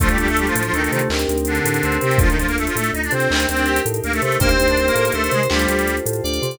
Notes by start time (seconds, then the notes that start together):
0.00 D2 F3 A3 D4 F4 A4, kick, closed hi-hat
0.09 G3 G4, closed hi-hat
0.18 D2 G3 G4, closed hi-hat
0.28 A3 A4, closed hi-hat
0.37 G3 G4, closed hi-hat
0.46 F3 F4, closed hi-hat
0.55 A2 F3 F4, closed hi-hat
0.63 F3 F4, closed hi-hat
0.73 D2 D#3 A3 D#4, closed hi-hat
0.82 D#3 D#4, closed hi-hat
0.92 C3 D#3 D#4, closed hi-hat
0.99 closed hi-hat
1.10 D2 C4 D#4 G4 A#4, clap
1.19 closed hi-hat
1.28 D2, closed hi-hat
1.38 closed hi-hat
1.45 D3 D4, closed hi-hat
1.55 closed hi-hat
1.65 A2, closed hi-hat
1.74 closed hi-hat
1.83 D2 C4, closed hi-hat
1.92 closed hi-hat
2.01 C3 C4, closed hi-hat
2.11 closed hi-hat
2.18 D2 F3 D4 F4 A4, kick, closed hi-hat
2.29 D#3 D#4, closed hi-hat
2.38 D2 F3 F4, closed hi-hat
2.47 A#3 A#4, closed hi-hat
2.57 A3 A4, closed hi-hat
2.66 F3 F4, closed hi-hat
2.75 A2 A3 A4, closed hi-hat
2.84 closed hi-hat
2.93 D2 D#4 D#5, closed hi-hat
3.03 D4 D5, closed hi-hat
3.11 C3 C4 C5, closed hi-hat
3.20 closed hi-hat
3.30 D2 D#4 G4 A#4, clap
3.40 closed hi-hat
3.49 D2 C4 C5, closed hi-hat
3.57 D4, closed hi-hat
3.66 G4, closed hi-hat
3.76 closed hi-hat
3.85 A2, closed hi-hat
3.94 closed hi-hat
4.04 D2 A#3 A#4, closed hi-hat
4.13 A3 A4, closed hi-hat
4.22 C3 A3 A4, closed hi-hat
4.32 closed hi-hat
4.40 D2 A#3 D#4 G4 A#4 C5, kick, closed hi-hat
4.49 C4 C5, closed hi-hat
4.59 D2 C4 C5, closed hi-hat
4.68 D4 D5, closed hi-hat
4.77 C4 C5, closed hi-hat
4.86 A#3 A#4, closed hi-hat
4.95 A2 A#3 A#4, closed hi-hat
5.05 A#3 A#4, closed hi-hat
5.12 D2 A3 A4 C5, closed hi-hat
5.23 A3 A4, closed hi-hat
5.31 C3 G#3 G#4, closed hi-hat
5.43 closed hi-hat
5.50 D2 G3 F4 G4 A4 C5, clap
5.59 closed hi-hat
5.68 D2, closed hi-hat
5.79 closed hi-hat
5.87 closed hi-hat
5.97 closed hi-hat
6.06 A2, closed hi-hat
6.13 closed hi-hat
6.24 D2 D5, closed hi-hat
6.33 closed hi-hat
6.42 C3, closed hi-hat
6.51 closed hi-hat